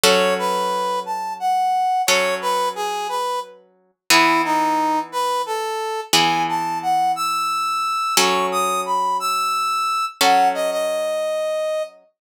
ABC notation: X:1
M:6/8
L:1/16
Q:3/8=59
K:E
V:1 name="Brass Section"
c2 B4 a2 f4 | c2 B2 G2 B2 z4 | E2 D4 B2 A4 | g2 a2 f2 e'6 |
c'2 d'2 b2 e'6 | f2 d d7 z2 |]
V:2 name="Acoustic Guitar (steel)"
[F,CA]12 | [F,CA]12 | [E,B,G]12 | [E,B,G]12 |
[F,CA]12 | [F,CA]12 |]